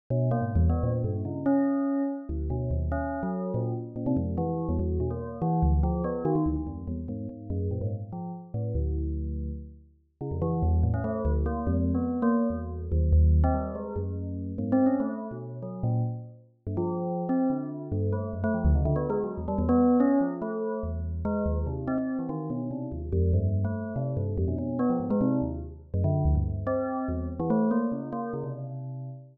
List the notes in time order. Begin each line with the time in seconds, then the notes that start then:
0.10 B2
0.31 A#3
0.42 G#2
0.56 E2
0.70 B3
0.83 A#2
1.04 G2
1.25 C#3
1.46 C#4
2.29 D2
2.50 B2
2.71 D#2
2.92 C#4
3.23 F#3
3.54 A#2
3.96 A#2
4.06 C3
4.17 F2
4.38 E3
4.69 E2
4.79 E2
5.00 B2
5.10 A#3
5.42 E3
5.63 D2
5.83 F3
6.04 B3
6.25 D#3
6.35 D#3
6.46 D2
6.56 D#3
6.67 F2
6.88 E2
7.08 G#2
7.29 G#2
7.50 F#2
7.71 A#2
7.81 G#2
8.13 F3
8.54 A2
8.75 D2
10.21 C#3
10.31 F2
10.42 E3
10.63 E2
10.83 A2
10.94 C#4
11.04 A3
11.25 D2
11.46 A#3
11.67 F2
11.94 B3
12.22 A#3
12.50 E2
12.92 D#2
13.13 D#2
13.44 C4
13.54 G3
13.75 G#3
13.96 F#2
14.58 G#2
14.72 C4
14.86 C#4
15.00 A3
15.31 B2
15.63 F#3
15.83 A#2
16.67 G2
16.77 F3
17.29 C4
17.50 D3
17.92 G2
18.13 A3
18.33 F#2
18.44 A3
18.54 F3
18.65 D2
18.75 C#3
18.85 D3
18.96 B3
19.10 G#3
19.24 F#3
19.38 E2
19.48 G3
19.58 E2
19.69 B3
20.00 C#4
20.21 F3
20.42 A3
20.83 E2
21.25 G#3
21.46 D#2
21.67 C3
21.88 C4
21.98 C4
22.19 E3
22.29 D#3
22.50 B2
22.71 C3
22.92 D#2
23.13 F2
23.33 G2
23.65 A3
23.96 C3
24.17 G2
24.38 F2
24.48 B2
24.58 B2
24.79 B3
24.90 F3
25.00 G#2
25.10 G#3
25.21 C3
25.42 D#2
25.94 F#2
26.04 D3
26.25 D2
26.35 G2
26.67 C4
27.08 E2
27.40 E3
27.50 A3
27.71 A#3
27.92 C#3
28.13 A#3
28.33 C#3
28.44 C3